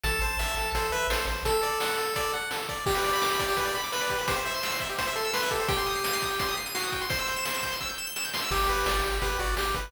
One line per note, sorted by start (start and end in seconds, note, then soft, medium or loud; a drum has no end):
0.04 0.19 A1 loud
0.04 0.20 A4 medium
0.04 0.70 A5 loud
0.04 kick medium
0.04 closed hi-hat medium
0.22 0.37 A1 loud
0.22 0.37 C5 medium
0.22 closed hi-hat medium
0.39 0.54 A1 medium
0.39 0.55 E5 medium
0.39 snare medium
0.57 0.72 A1 medium
0.57 0.73 A4 medium
0.57 closed hi-hat medium
0.74 0.89 A1 medium
0.74 0.92 A4 medium
0.74 0.91 C5 medium
0.74 kick medium
0.74 closed hi-hat medium
0.92 1.07 A1 medium
0.92 1.07 B4 medium
0.92 1.08 E5 medium
0.92 closed hi-hat medium
1.10 1.25 A1 medium
1.10 1.26 A4 medium
1.10 1.26 C5 medium
1.10 snare medium
1.27 1.43 A1 loud
1.27 1.44 C5 medium
1.27 closed hi-hat medium
1.45 1.61 A4 loud
1.45 2.33 A4 medium
1.45 kick medium
1.45 closed hi-hat medium
1.63 1.79 D5 medium
1.63 closed hi-hat medium
1.80 1.96 F#5 medium
1.80 snare medium
1.98 2.14 A4 medium
1.98 closed hi-hat medium
2.16 2.32 D5 medium
2.16 kick medium
2.16 closed hi-hat medium
2.33 2.49 F#5 medium
2.33 closed hi-hat medium
2.51 2.67 A4 medium
2.51 snare medium
2.69 2.85 D5 medium
2.69 kick medium
2.69 closed hi-hat medium
2.86 3.77 G4 medium
2.86 2.94 G4 loud
2.86 kick loud
2.86 crash medium
2.95 3.03 B4 medium
2.95 closed hi-hat medium
3.04 3.12 D5 medium
3.04 snare soft
3.04 closed hi-hat medium
3.13 3.21 B5 medium
3.13 closed hi-hat medium
3.21 3.29 D6 medium
3.21 snare medium
3.30 3.39 B5 medium
3.30 closed hi-hat medium
3.39 3.47 D5 medium
3.39 kick medium
3.39 closed hi-hat medium
3.48 3.56 G4 medium
3.48 closed hi-hat medium
3.57 3.65 B4 medium
3.57 kick medium
3.57 closed hi-hat medium
3.66 3.74 D5 medium
3.66 closed hi-hat medium
3.75 3.83 B5 medium
3.75 closed hi-hat medium
3.83 3.92 D6 medium
3.83 closed hi-hat medium
3.92 4.21 B4 medium
3.92 4.00 B5 medium
3.92 snare medium
4.01 4.09 D5 medium
4.01 closed hi-hat medium
4.10 4.18 G4 medium
4.10 kick medium
4.10 closed hi-hat medium
4.19 4.27 B4 medium
4.19 closed hi-hat medium
4.28 4.36 G4 medium
4.28 4.84 C5 medium
4.28 kick medium
4.28 closed hi-hat medium
4.36 4.44 C5 medium
4.36 closed hi-hat medium
4.45 4.53 E5 medium
4.45 snare soft
4.45 closed hi-hat medium
4.54 4.62 C6 medium
4.54 closed hi-hat medium
4.63 4.71 E6 medium
4.63 snare medium
4.72 4.80 C6 medium
4.72 closed hi-hat medium
4.80 4.88 E5 medium
4.80 kick medium
4.80 closed hi-hat medium
4.89 4.97 G4 medium
4.89 closed hi-hat medium
4.98 5.06 C5 medium
4.98 5.13 C5 medium
4.98 kick medium
4.98 closed hi-hat medium
5.07 5.15 E5 medium
5.07 closed hi-hat medium
5.16 5.31 A4 medium
5.16 5.24 C6 medium
5.16 closed hi-hat medium
5.24 5.33 E6 medium
5.24 closed hi-hat medium
5.33 5.50 B4 medium
5.33 5.41 C6 medium
5.33 snare medium
5.42 5.50 E5 medium
5.42 closed hi-hat medium
5.51 5.59 G4 medium
5.51 5.68 A4 medium
5.51 kick medium
5.51 closed hi-hat medium
5.60 5.68 C5 medium
5.60 closed hi-hat medium
5.68 6.54 G4 medium
5.68 5.76 G5 loud
5.68 kick loud
5.68 closed hi-hat medium
5.77 5.86 C6 medium
5.77 closed hi-hat medium
5.86 5.94 D#6 medium
5.86 snare soft
5.86 closed hi-hat medium
5.95 6.03 C7 medium
5.95 closed hi-hat medium
6.04 6.12 D#7 medium
6.04 snare medium
6.13 6.21 C7 medium
6.13 closed hi-hat medium
6.22 6.30 D#6 medium
6.22 kick medium
6.22 closed hi-hat medium
6.30 6.39 G5 medium
6.30 closed hi-hat medium
6.39 6.47 C6 medium
6.39 kick medium
6.39 closed hi-hat medium
6.48 6.56 D#6 medium
6.48 closed hi-hat medium
6.57 6.65 C7 medium
6.57 closed hi-hat medium
6.66 6.74 D#7 medium
6.66 closed hi-hat medium
6.75 7.06 F#4 medium
6.75 6.83 C7 medium
6.75 snare medium
6.84 6.92 D#6 medium
6.84 closed hi-hat medium
6.92 7.00 G5 medium
6.92 kick medium
6.92 closed hi-hat medium
7.01 7.09 C6 medium
7.01 closed hi-hat medium
7.10 7.76 C5 medium
7.10 7.18 C6 medium
7.10 kick medium
7.10 closed hi-hat medium
7.19 7.27 E6 medium
7.19 closed hi-hat medium
7.27 7.36 G6 medium
7.27 snare soft
7.27 closed hi-hat medium
7.36 7.44 E7 medium
7.36 closed hi-hat medium
7.45 7.53 G7 medium
7.45 snare medium
7.54 7.62 E7 medium
7.54 closed hi-hat medium
7.63 7.71 G6 medium
7.63 kick medium
7.63 closed hi-hat medium
7.72 7.80 C6 medium
7.72 closed hi-hat medium
7.80 7.89 E6 medium
7.80 kick medium
7.80 snare medium
7.89 7.97 G6 medium
7.98 8.06 E7 medium
8.07 8.15 G7 medium
8.16 8.24 E7 medium
8.16 snare medium
8.25 8.33 G6 medium
8.34 8.41 C6 medium
8.34 snare medium
8.42 8.50 E6 medium
8.51 8.66 G1 loud
8.51 9.18 G4 medium
8.51 8.67 G4 medium
8.51 kick medium
8.51 crash medium
8.69 8.84 G1 medium
8.69 8.85 B4 medium
8.69 closed hi-hat medium
8.86 9.01 G1 medium
8.86 9.02 D5 medium
8.86 snare medium
9.03 9.19 G1 medium
9.03 9.20 G4 medium
9.03 closed hi-hat medium
9.22 9.37 G1 medium
9.22 9.38 G4 medium
9.22 9.37 B4 medium
9.22 kick medium
9.22 closed hi-hat medium
9.39 9.54 G1 loud
9.39 9.55 F#4 medium
9.39 9.56 D5 medium
9.39 closed hi-hat medium
9.57 9.72 G1 medium
9.57 9.73 G4 medium
9.57 9.75 G4 medium
9.57 snare medium
9.74 9.90 G1 medium
9.74 9.90 B4 medium
9.74 kick medium
9.74 closed hi-hat medium